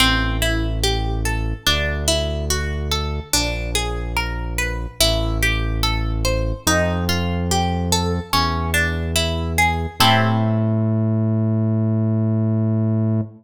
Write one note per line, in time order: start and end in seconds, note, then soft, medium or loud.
0.00 1.53 A1 medium
0.00 0.37 C4 loud
0.42 0.79 E4 medium
0.84 1.21 G4 medium
1.25 1.63 A4 medium
1.66 3.20 D2 medium
1.66 2.04 D4 loud
2.08 2.45 E4 medium
2.50 2.88 F#4 medium
2.91 3.29 A4 medium
3.33 4.87 A#1 medium
3.33 3.71 D4 loud
3.75 4.12 G#4 medium
4.16 4.54 A#4 medium
4.58 4.96 B4 medium
5.00 6.53 A1 loud
5.00 5.38 E4 loud
5.43 5.80 G4 medium
5.83 6.21 A4 loud
6.25 6.62 C5 medium
6.67 8.20 F2 loud
6.67 7.05 D#4 loud
7.09 7.46 F4 medium
7.51 7.89 G4 medium
7.92 8.30 A4 medium
8.33 9.87 E2 medium
8.33 8.70 C#4 medium
8.74 9.11 D4 medium
9.16 9.53 E4 medium
9.58 9.96 G#4 medium
10.00 13.21 A2 loud
10.00 13.22 C4 medium
10.00 13.22 E4 loud
10.00 13.22 G4 loud
10.00 13.22 A4 loud